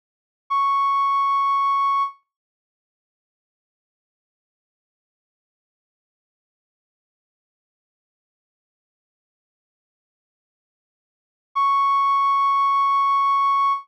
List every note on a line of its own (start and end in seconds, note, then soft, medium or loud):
0.50 2.03 C#6 medium
11.55 13.73 C#6 medium